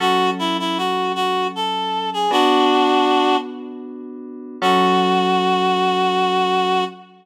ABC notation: X:1
M:3/4
L:1/16
Q:1/4=78
K:F#m
V:1 name="Clarinet"
F2 E E F2 F2 A3 G | [DF]6 z6 | F12 |]
V:2 name="Electric Piano 2"
[F,CA]12 | [B,DF]12 | [F,CA]12 |]